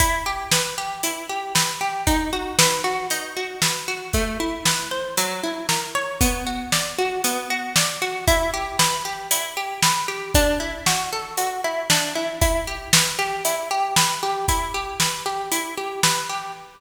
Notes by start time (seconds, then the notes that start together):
0.00 E4, kick, closed hi-hat
0.26 G4
0.52 B4, snare
0.78 G4
1.03 E4, closed hi-hat
1.29 G4
1.55 B4, snare
1.81 G4
2.07 D#4, kick, closed hi-hat
2.33 F#4
2.59 B4, snare
2.84 F#4
3.10 D#4, closed hi-hat
3.37 F#4
3.62 B4, snare
3.88 F#4
4.13 A3, kick, closed hi-hat
4.40 E4
4.65 B4, snare
4.91 C5
5.17 F#3, closed hi-hat
5.43 E4
5.69 A#4, snare
5.95 C#5
6.21 B3, kick, closed hi-hat
6.47 F#4
6.72 D5, snare
6.98 F#4
7.24 B3, closed hi-hat
7.50 F#4
7.76 D5, snare
8.02 F#4
8.27 E4, kick, closed hi-hat
8.54 G4
8.79 B4, snare
9.05 G4
9.31 E4, closed hi-hat
9.57 G4
9.82 B4, snare
10.08 G4
10.34 D4, kick, closed hi-hat
10.60 E4
10.86 F#4, snare
11.12 A4
11.37 F#4, closed hi-hat
11.64 E4
11.90 D4, snare
12.15 E4
12.41 E4, kick, closed hi-hat
12.67 G4
12.93 B4, snare
13.19 G4
13.45 E4, closed hi-hat
13.71 G4
13.96 B4, snare
14.23 G4
14.48 E4, kick, closed hi-hat
14.74 G4
15.00 B4, snare
15.26 G4
15.52 E4, closed hi-hat
15.77 G4
16.03 B4, snare
16.29 G4